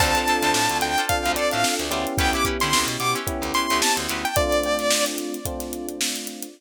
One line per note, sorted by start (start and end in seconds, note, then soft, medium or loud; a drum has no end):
0.00 0.15 D2 medium
0.00 0.99 C4 loud
0.00 0.12 D4 medium
0.00 0.99 D4 loud
0.00 0.99 F4 loud
0.00 0.12 F4 medium
0.00 0.99 A4 loud
0.00 0.12 A4 medium
0.00 0.12 C5 medium
0.00 0.77 A5 loud
0.00 kick medium
0.00 crash loud
0.15 0.25 D4 medium
0.15 0.25 F4 medium
0.15 0.25 A4 medium
0.15 0.25 C5 medium
0.15 closed hi-hat medium
0.27 0.40 D4 medium
0.27 0.40 F4 medium
0.27 0.40 A4 medium
0.27 0.40 C5 medium
0.27 closed hi-hat medium
0.42 0.53 D2 medium
0.42 0.85 D4 medium
0.42 0.85 F4 medium
0.42 0.85 A4 medium
0.42 0.85 C5 medium
0.42 snare medium
0.42 closed hi-hat medium
0.54 0.68 A2 medium
0.54 snare loud
0.69 0.81 D2 medium
0.69 closed hi-hat medium
0.81 0.96 D2 medium
0.81 1.05 G5 medium
0.81 snare soft
0.81 closed hi-hat medium
0.98 1.30 D4 medium
0.98 1.30 F4 medium
0.98 1.30 A4 medium
0.98 1.30 C5 medium
0.98 closed hi-hat medium
1.09 1.87 C4 medium
1.09 1.87 D4 medium
1.09 1.87 F4 medium
1.09 1.87 A4 medium
1.09 1.32 F5 medium
1.09 kick medium
1.09 closed hi-hat medium
1.25 1.36 D2 medium
1.25 closed hi-hat medium
1.36 1.49 D4 medium
1.36 1.49 F4 medium
1.36 1.49 A4 medium
1.36 1.49 C5 medium
1.36 1.51 D5 medium
1.36 closed hi-hat medium
1.51 1.64 A2 medium
1.51 1.84 D4 medium
1.51 1.84 F4 medium
1.51 1.84 A4 medium
1.51 1.84 C5 medium
1.51 1.74 F5 medium
1.51 closed hi-hat medium
1.64 snare loud
1.79 1.90 D2 medium
1.79 closed hi-hat medium
1.90 2.05 D2 medium
1.90 3.17 B3 loud
1.90 3.17 C#4 loud
1.90 2.14 D4 medium
1.90 3.17 E4 loud
1.90 2.14 F4 medium
1.90 3.17 G4 loud
1.90 2.14 A4 medium
1.90 2.14 C5 medium
1.90 closed hi-hat medium
2.07 closed hi-hat medium
2.18 2.34 D2 medium
2.18 2.31 C#4 medium
2.18 2.31 E4 medium
2.18 2.31 G4 medium
2.18 2.31 B4 medium
2.18 2.33 G5 medium
2.18 kick loud
2.18 closed hi-hat medium
2.33 2.44 C#4 medium
2.33 2.44 E4 medium
2.33 2.44 G4 medium
2.33 2.44 B4 medium
2.33 2.45 D6 medium
2.33 closed hi-hat medium
2.45 2.58 C#4 medium
2.45 2.58 E4 medium
2.45 2.58 G4 medium
2.45 2.58 B4 medium
2.45 kick medium
2.45 closed hi-hat medium
2.60 2.73 D3 medium
2.60 3.03 C#4 medium
2.60 3.03 E4 medium
2.60 3.03 G4 medium
2.60 3.03 B4 medium
2.60 2.86 C6 medium
2.60 snare medium
2.60 closed hi-hat medium
2.73 2.89 D2 medium
2.73 snare loud
2.87 2.97 B2 medium
2.87 closed hi-hat medium
3.00 3.14 B2 medium
3.00 3.15 D6 medium
3.00 closed hi-hat medium
3.15 3.47 C#4 medium
3.15 3.47 E4 medium
3.15 3.47 G4 medium
3.15 3.47 B4 medium
3.15 closed hi-hat medium
3.27 4.26 B3 medium
3.27 4.26 C#4 medium
3.27 4.26 E4 medium
3.27 4.26 G4 medium
3.27 kick medium
3.27 closed hi-hat medium
3.42 3.52 D2 medium
3.42 closed hi-hat medium
3.54 3.67 C#4 medium
3.54 3.67 E4 medium
3.54 3.67 G4 medium
3.54 3.67 B4 medium
3.54 3.81 C6 medium
3.54 closed hi-hat medium
3.70 3.81 D2 medium
3.70 4.02 C#4 medium
3.70 4.02 E4 medium
3.70 4.02 G4 medium
3.70 4.02 B4 medium
3.70 closed hi-hat medium
3.82 3.97 A5 medium
3.82 snare loud
3.97 4.07 D2 medium
3.97 closed hi-hat medium
4.09 4.24 D2 medium
4.09 4.31 C#4 medium
4.09 4.31 E4 medium
4.09 4.31 G4 medium
4.09 4.31 B4 medium
4.09 closed hi-hat medium
4.25 4.36 G5 medium
4.25 closed hi-hat medium
4.36 5.36 A3 loud
4.36 5.36 C4 medium
4.36 5.36 D4 loud
4.36 5.36 F4 loud
4.36 5.05 D5 medium
4.36 kick loud
4.36 closed hi-hat medium
4.52 closed hi-hat medium
4.64 closed hi-hat medium
4.79 snare soft
4.79 closed hi-hat medium
4.90 snare loud
5.06 closed hi-hat medium
5.18 closed hi-hat medium
5.34 closed hi-hat medium
5.45 6.45 A3 medium
5.45 6.45 C4 medium
5.45 6.45 D4 medium
5.45 6.45 F4 medium
5.45 kick medium
5.45 closed hi-hat medium
5.60 snare soft
5.60 closed hi-hat medium
5.73 closed hi-hat medium
5.89 closed hi-hat medium
6.01 snare loud
6.16 closed hi-hat medium
6.27 closed hi-hat medium
6.43 closed hi-hat medium